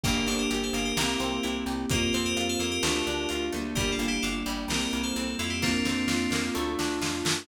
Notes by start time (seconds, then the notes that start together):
0.03 G1 A#3 D4 G4 A#4, kick, crash
0.26 G1 D4 A4 C5, closed hi-hat
0.39 G4 A#4
0.50 G1 G4, closed hi-hat
0.63 A4 C5
0.73 G1 A#3 G4 A#4, closed hi-hat
0.85 G4 A#4
0.97 C2 A#3 C4 E4 G4, snare
1.20 C2 C4, closed hi-hat
1.43 C2 E4, closed hi-hat
1.66 C2 G4, closed hi-hat
1.89 F2 A#3 C4 F4 G4 A#4, kick, closed hi-hat
2.13 F2 C4 A4 C5, closed hi-hat
2.25 G4 A#4
2.37 F2 F4, closed hi-hat
2.49 A4 C5
2.59 F2 A#3 G4 A#4, closed hi-hat
2.71 G4 A#4
2.83 D2 A3 D4 F4, snare
3.07 D2 D4, closed hi-hat
3.29 D2 F4, closed hi-hat
3.52 D2 G3 A3 A#3 D4, closed hi-hat
3.75 G1 G3 G4 A#4, kick, closed hi-hat
3.92 F4 A4
3.99 G1 A#3, closed hi-hat
4.08 E4 G4
4.22 G1 D4 F4 A4, closed hi-hat
4.46 G1 G3, closed hi-hat
4.68 C2 G3 A#3 C4 E4 G4 A#4, snare
4.81 G4 A#4
4.91 C2 A#3, closed hi-hat
5.03 A4 C5
5.16 C2 C4, closed hi-hat
5.39 F2 E4 F4 A4, closed hi-hat
5.50 E4 G4
5.62 A#3 C4 D4 F4, kick, snare
5.85 F2 C4, snare
6.08 F2 F4, snare
6.30 F2 A#3, snare
6.54 D2 A3 D4 F4
6.79 D2 D4, snare
7.01 F2 F4, snare
7.25 F#2 A3, snare